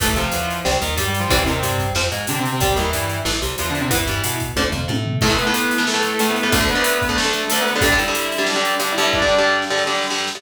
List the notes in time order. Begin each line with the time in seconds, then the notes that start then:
0.00 A1 E3 A3 A4, kick, closed hi-hat
0.16 C2 C3 F3 F4, closed hi-hat
0.32 E2 E3, closed hi-hat
0.50 closed hi-hat
0.65 C2 G3 C4, snare
0.81 D#2 D#3, closed hi-hat
0.97 G2 G3 G4, closed hi-hat
1.08 G3 G4
1.14 closed hi-hat
1.19 F3 F4
1.29 C2 E3 G3 C4 E4, kick, closed hi-hat
1.45 D#2 C3 D#3 C4, closed hi-hat
1.63 G2 G3, closed hi-hat
1.78 kick, closed hi-hat
1.95 F2 F3 C4, snare
2.12 G#2 G#3, closed hi-hat
2.27 C3 D3 C4 D4, closed hi-hat
2.39 C3 C4
2.45 closed hi-hat
2.52 C3 C4
2.60 C2 G3 C4 G4, kick, closed hi-hat
2.76 D#2 D#3 E3 E4, closed hi-hat
2.93 G2 G3, closed hi-hat
3.10 closed hi-hat
3.25 A1 E3 A3, snare
3.42 C2 C3, closed hi-hat
3.58 E2 E3 F3 F4, closed hi-hat
3.70 D3 D4
3.75 closed hi-hat
3.80 C3 C4
3.91 E2 E3 B3 E4, kick, closed hi-hat
4.07 G2 G3, closed hi-hat
4.24 B2 B3, closed hi-hat
4.40 kick, closed hi-hat
4.56 D2 D3 F3 A3, kick, high tom
4.72 F2 F3, floor tom
4.88 A2 A3, high tom
5.06 floor tom
5.21 A2 E3 A3 A4, kick, crash
5.30 A2 E3 A3
5.38 B3 B4, closed hi-hat
5.47 A2 E3 A3
5.54 closed hi-hat
5.71 closed hi-hat
5.78 A2 E3 A3
5.87 A3 A4, snare
5.94 A2 E3 A3
6.03 closed hi-hat
6.19 A2 E3 A3 A4, closed hi-hat
6.30 B3 B4
6.36 closed hi-hat
6.43 A2 E3 A3 B3 B4
6.52 D2 D3 A3 A4, kick, closed hi-hat
6.60 D2 D3 A3
6.68 B3 B4, closed hi-hat
6.75 D2 D3 A3
6.84 closed hi-hat
7.02 kick, closed hi-hat
7.09 D2 D3 A3
7.16 A3 A4, snare
7.25 D2 D3 A3
7.33 closed hi-hat
7.48 D2 D3 A3 A4, closed hi-hat
7.61 B3 B4
7.67 closed hi-hat
7.71 B3 B4
7.76 D2 D3 A3
7.81 G2 D3 G3 D4 D5, kick, closed hi-hat
7.92 G2 D3 G3
7.98 E4 E5, closed hi-hat
8.08 G2 D3 G3
8.15 closed hi-hat
8.32 closed hi-hat
8.38 G2 D3 G3
8.46 D4 D5, snare
8.56 G2 D3 G3
8.65 closed hi-hat
8.79 G2 D3 G3 D4 D5, closed hi-hat
8.92 E4 E5
8.98 G2 D3 G3, closed hi-hat
9.02 E4 E5
9.13 D4 D5, kick, snare
9.22 G2 D3 G3
9.28 snare
9.38 G2 D3 G3
9.47 snare
9.62 snare
9.70 G2 D3 G3
9.77 snare
9.87 G2 D3 G3, snare
9.94 snare
10.02 snare
10.10 G2 D3 G3, snare
10.18 snare
10.27 snare
10.35 G2 D3 G3, snare